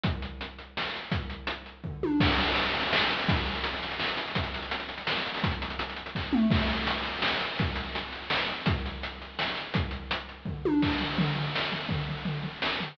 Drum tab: CC |------------|------------|x-----------|------------|
HH |x-x-x-x---x-|x-x-x-x-----|-xxxxxxx-xxx|xxxxxxxx-xxx|
SD |--------o---|------------|--------o---|--------o---|
T1 |------------|----------o-|------------|------------|
T2 |------------|------------|------------|------------|
FT |------------|--------o---|------------|------------|
BD |o-----------|o-------o---|o-----------|o-----------|

CC |------------|------------|x-----------|------------|
HH |xxxxxxxx-xxo|xxxxxxxx----|--x-x-x---x-|x-x-x-x---x-|
SD |--------o---|--------o---|--------o---|--------o---|
T1 |------------|------------|------------|------------|
T2 |------------|----------o-|------------|------------|
FT |------------|------------|------------|------------|
BD |o-----------|o-------o---|o-----------|o-----------|

CC |------------|------------|x-----------|------------|
HH |x-x-x-x---x-|x-x-x-x-----|------------|------------|
SD |--------o---|------------|--------o---|--------o---|
T1 |------------|----------o-|------------|------------|
T2 |------------|------------|------------|------------|
FT |------------|--------o---|--o-o-o---o-|o-o-o-o---o-|
BD |o-----------|o-------o---|o-----------|o-----------|